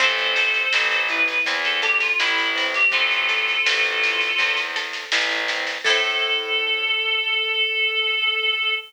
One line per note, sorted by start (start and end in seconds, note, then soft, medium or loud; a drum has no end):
0.00 0.66 A1 medium
0.00 0.72 C4 loud
0.00 1.01 A4 medium
0.00 1.01 C5 medium
0.00 kick loud
0.00 snare medium
0.18 snare medium
0.36 1.82 A4 medium
0.36 snare medium
0.54 snare medium
0.73 1.39 A1 medium
0.73 1.47 C4 loud
0.73 snare loud
0.92 snare medium
1.08 2.20 E4 medium
1.08 1.39 B4 medium
1.08 snare medium
1.28 snare medium
1.46 2.12 E2 medium
1.46 2.55 C4 loud
1.46 kick medium
1.46 snare medium
1.64 1.81 A4 medium
1.64 snare medium
1.82 2.00 G4 medium
1.82 3.29 A4 loud
1.82 snare medium
2.00 2.18 F4 medium
2.00 snare medium
2.19 2.85 A1 medium
2.19 2.64 E4 medium
2.19 4.02 E4 medium
2.19 snare loud
2.38 snare medium
2.55 2.92 C4 medium
2.55 snare medium
2.74 2.92 G4 medium
2.74 snare medium
2.91 3.58 A1 medium
2.91 3.66 C4 loud
2.91 4.56 F4 medium
2.91 4.56 A4 medium
2.91 kick loud
2.91 snare medium
3.11 snare medium
3.29 4.75 A4 medium
3.29 snare medium
3.48 snare medium
3.66 4.32 A1 medium
3.66 4.38 C4 medium
3.66 snare loud
3.83 snare medium
4.02 5.12 E4 medium
4.02 snare medium
4.21 snare medium
4.38 5.05 E2 medium
4.38 5.49 C4 medium
4.38 kick medium
4.38 snare medium
4.57 snare medium
4.76 5.80 A4 medium
4.76 snare medium
4.93 snare medium
5.12 5.78 A1 medium
5.12 5.82 E4 loud
5.12 snare loud
5.31 snare medium
5.48 5.84 C4 medium
5.48 snare medium
5.67 snare medium
5.84 8.73 A2 loud
5.84 8.71 E4 loud
5.84 8.71 A4 loud
5.84 8.72 A4 loud
5.84 kick loud
5.84 crash loud
5.89 8.71 C4 loud